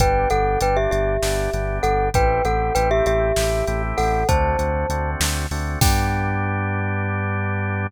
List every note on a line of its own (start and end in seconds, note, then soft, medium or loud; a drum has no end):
0.00 0.26 G1 medium
0.00 0.28 B3 medium
0.00 0.28 D4 medium
0.00 0.28 G4 medium
0.00 0.29 B4 loud
0.00 0.29 G5 loud
0.00 kick medium
0.00 closed hi-hat medium
0.30 0.57 G1 medium
0.30 0.59 B3 medium
0.30 0.59 D4 medium
0.30 0.59 G4 medium
0.30 0.60 A4 loud
0.30 0.60 F#5 loud
0.30 closed hi-hat medium
0.60 0.87 G1 medium
0.60 1.17 B3 medium
0.60 1.17 D4 medium
0.60 1.17 G4 medium
0.60 0.77 B4 medium
0.60 0.77 G5 loud
0.60 closed hi-hat medium
0.77 0.91 G4 medium
0.77 0.91 E5 loud
0.91 1.18 G1 medium
0.91 1.78 G4 medium
0.91 1.78 E5 medium
0.91 closed hi-hat medium
1.22 1.48 G1 medium
1.22 1.50 B3 medium
1.22 1.50 D4 medium
1.22 1.50 G4 medium
1.22 snare medium
1.53 1.79 G1 medium
1.53 2.10 B3 medium
1.53 2.10 D4 medium
1.53 2.10 G4 medium
1.53 closed hi-hat medium
1.83 2.10 G1 medium
1.83 2.09 A4 loud
1.83 2.09 F#5 loud
1.83 closed hi-hat medium
2.14 2.40 A1 medium
2.14 2.42 A3 medium
2.14 2.42 C4 medium
2.14 2.42 E4 medium
2.14 2.42 G4 medium
2.14 2.44 B4 loud
2.14 2.44 G5 loud
2.14 kick medium
2.14 closed hi-hat medium
2.45 2.71 A1 medium
2.45 2.73 A3 medium
2.45 2.73 C4 medium
2.45 2.73 E4 medium
2.45 2.73 G4 medium
2.45 2.74 A4 medium
2.45 2.74 F#5 loud
2.45 closed hi-hat medium
2.75 3.02 A1 medium
2.75 3.32 A3 medium
2.75 3.32 C4 medium
2.75 3.32 E4 medium
2.75 3.32 G4 medium
2.75 2.89 B4 loud
2.75 2.89 G5 loud
2.75 closed hi-hat medium
2.91 3.05 G4 loud
2.91 3.05 E5 loud
3.06 3.32 A1 medium
3.06 3.82 G4 loud
3.06 3.82 E5 loud
3.06 closed hi-hat medium
3.36 3.63 A1 medium
3.36 3.65 A3 medium
3.36 3.65 C4 medium
3.36 3.65 E4 medium
3.36 3.65 G4 medium
3.36 snare medium
3.67 3.93 A1 medium
3.67 4.24 A3 medium
3.67 4.24 C4 medium
3.67 4.24 E4 medium
3.67 4.24 G4 medium
3.67 closed hi-hat medium
3.98 4.24 A1 medium
3.98 4.27 A4 medium
3.98 4.27 F#5 loud
3.98 open hi-hat medium
4.29 4.55 D2 loud
4.29 4.57 A3 medium
4.29 4.57 C4 medium
4.29 4.57 D4 medium
4.29 4.57 F#4 medium
4.29 5.10 C5 medium
4.29 5.10 A5 loud
4.29 kick medium
4.29 closed hi-hat medium
4.58 4.85 D2 medium
4.58 4.87 A3 medium
4.58 4.87 C4 medium
4.58 4.87 D4 medium
4.58 4.87 F#4 medium
4.58 closed hi-hat medium
4.90 5.16 D2 medium
4.90 5.46 A3 medium
4.90 5.46 C4 medium
4.90 5.46 D4 medium
4.90 5.46 F#4 medium
4.90 closed hi-hat medium
5.20 5.46 D2 medium
5.20 snare loud
5.51 5.77 D2 medium
5.51 5.79 A3 medium
5.51 5.79 C4 medium
5.51 5.79 D4 medium
5.51 5.79 F#4 medium
5.51 open hi-hat medium
5.81 7.86 G2 loud
5.81 7.87 B3 loud
5.81 7.87 D4 loud
5.81 7.87 G4 loud
5.81 7.86 G5 loud
5.81 kick loud
5.81 crash loud